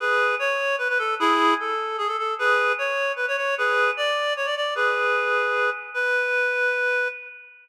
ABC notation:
X:1
M:6/8
L:1/16
Q:3/8=101
K:Bdor
V:1 name="Clarinet"
[GB]4 c4 B B A2 | [E_A]4 =A4 _A =A A2 | [GB]4 c4 B c c2 | [GB]4 d4 c d d2 |
[GB]10 z2 | B12 |]